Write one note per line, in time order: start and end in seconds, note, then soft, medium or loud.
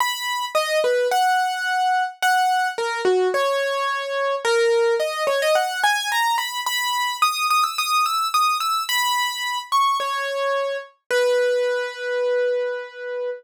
0.00 0.45 B5 loud
0.55 0.79 D#5 loud
0.84 1.07 B4 medium
1.11 2.03 F#5 loud
2.22 2.68 F#5 loud
2.78 3.01 A#4 medium
3.05 3.28 F#4 medium
3.34 4.35 C#5 loud
4.45 4.95 A#4 loud
5.00 5.24 D#5 medium
5.27 5.40 C#5 medium
5.42 5.55 D#5 loud
5.55 5.80 F#5 loud
5.84 6.09 G#5 loud
6.12 6.36 A#5 loud
6.38 6.60 B5 medium
6.66 7.17 B5 loud
7.22 7.46 D#6 loud
7.50 7.64 D#6 medium
7.64 7.77 E6 medium
7.78 8.04 D#6 loud
8.06 8.28 E6 medium
8.34 8.57 D#6 medium
8.60 8.83 E6 medium
8.89 9.59 B5 loud
9.72 9.97 C#6 medium
10.00 10.77 C#5 medium
11.11 13.30 B4 loud